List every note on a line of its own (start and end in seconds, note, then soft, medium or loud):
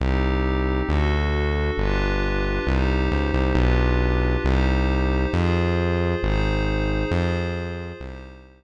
0.00 0.82 C2 medium
0.00 0.88 C4 medium
0.00 0.88 D#4 loud
0.00 0.88 G4 loud
0.89 1.70 D2 medium
0.89 1.77 D4 medium
0.89 1.77 F#4 loud
0.89 1.77 A4 loud
1.77 2.59 G1 medium
1.77 2.66 D4 loud
1.77 2.66 F4 loud
1.77 2.66 G4 loud
1.77 2.66 B4 loud
2.67 3.09 C2 loud
2.67 3.56 D#4 loud
2.67 3.55 G4 loud
2.67 3.56 C5 medium
3.12 3.32 C#2 medium
3.33 3.53 C2 medium
3.55 4.37 B1 loud
3.55 4.43 D4 medium
3.55 4.43 F4 loud
3.55 4.43 G4 loud
3.55 4.43 B4 medium
4.44 5.26 C2 loud
4.44 5.32 D#4 loud
4.44 5.32 G4 loud
4.44 5.32 C5 loud
5.33 6.15 F2 medium
5.33 6.21 F4 loud
5.33 6.21 G#4 loud
5.33 6.21 C5 medium
6.22 7.04 G#1 medium
6.22 7.10 D#4 loud
6.22 7.10 G#4 loud
6.22 7.10 C5 loud
7.11 7.93 F2 medium
7.11 8.00 F4 medium
7.11 8.00 G#4 loud
7.11 8.00 C5 loud
8.00 8.64 C2 medium
8.00 8.64 D#4 medium
8.00 8.64 G4 loud
8.00 8.64 C5 loud